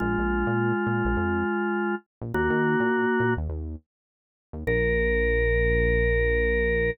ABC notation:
X:1
M:4/4
L:1/16
Q:"Swing 16ths" 1/4=103
K:Bbm
V:1 name="Drawbar Organ"
[A,F]16 | [B,G]8 z8 | B16 |]
V:2 name="Synth Bass 1" clef=bass
B,,, B,,,2 B,,3 B,, B,,, F,,7 B,,, | E,, E,2 B,,3 B,, E,, E,,7 E,, | B,,,16 |]